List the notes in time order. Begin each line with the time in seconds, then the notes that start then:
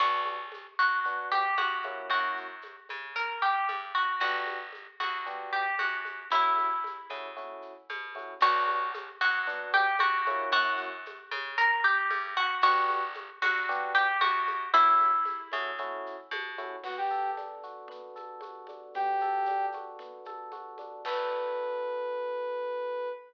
0.00 B1 B3 D4 F#4, crash, low conga, shaker
0.26 high conga, shaker
0.52 high conga, shaker
0.79 F#2 F#4, shaker
1.05 B3 D4 F#4, low conga, shaker
1.31 G4, high conga, shaker
1.57 F#2 F#4, high conga, shaker
1.82 A#3 C#4 E4 F#4, high conga, shaker
2.10 F#2 F#4, low conga, shaker
2.37 shaker
2.62 high conga, shaker
2.89 C#3, high conga, shaker
3.15 A#4, low conga, shaker
3.41 G4, shaker
3.68 G2, high conga, shaker
3.95 F#4, shaker
4.20 G1 B3 D4 F#4 G4, low conga, shaker
4.47 high conga, shaker
4.72 high conga, shaker
5.00 D2 F#4, high conga, shaker
5.26 B3 D4 F#4 G4, low conga, shaker
5.53 G4, shaker
5.79 F#2 F#4, high conga, shaker
6.05 high conga, shaker
6.30 F#2 A3 C#4 E4 F#4, low conga, shaker
6.57 high conga, shaker
6.84 high conga, shaker
7.10 C#3 A3 C#4 E4 F#4, high conga, shaker
7.36 A3 C#4 E4 F#4, low conga, shaker
7.62 shaker
7.89 B2, high conga, shaker
8.15 A3 C#4 E4 F#4, high conga, shaker
8.40 B1 B3 D4 F#4, crash, low conga, shaker
8.68 high conga, shaker
8.94 high conga, shaker
9.21 F#2 F#4, shaker
9.47 B3 D4 F#4, low conga, shaker
9.73 G4, high conga, shaker
9.99 F#2 F#4, high conga, shaker
10.27 A#3 C#4 E4 F#4, high conga, shaker
10.52 F#2 F#4, low conga, shaker
10.77 shaker
11.06 high conga, shaker
11.31 C#3, high conga, shaker
11.58 A#4, low conga, shaker
11.83 G4, shaker
12.10 G2, high conga, shaker
12.36 F#4, shaker
12.61 G1 B3 D4 F#4 G4, low conga, shaker
12.90 high conga, shaker
13.14 high conga, shaker
13.42 D2 F#4, high conga, shaker
13.69 B3 D4 F#4 G4, low conga, shaker
13.95 G4, shaker
14.21 F#2 F#4, high conga, shaker
14.47 high conga, shaker
14.73 F#2 A3 C#4 E4 F#4, low conga, shaker
15.00 high conga, shaker
15.25 high conga, shaker
15.52 C#3 A3 C#4 E4 F#4, high conga, shaker
15.78 A3 C#4 E4 F#4, low conga, shaker
16.06 shaker
16.31 B2, high conga, shaker
16.58 A3 C#4 E4 F#4, high conga, shaker
16.84 B3 F#4, crash, low conga, shaker
16.97 G4
17.10 A4, shaker
17.37 D4, high conga, shaker
17.63 F#4, shaker
17.88 B3, low conga, shaker
18.16 A4, high conga, shaker
18.41 F#4, high conga, shaker
18.67 D4, high conga, shaker
18.94 B3 G4, low conga, shaker
19.20 A4, high conga, shaker
19.46 D4, high conga, shaker
19.72 F#4, high conga, shaker
19.99 B3, low conga, shaker
20.25 A4, high conga, shaker
20.51 F#4, high conga, shaker
20.78 D4, high conga, shaker
21.05 B3 D4 F#4 A4 B4, kick, crash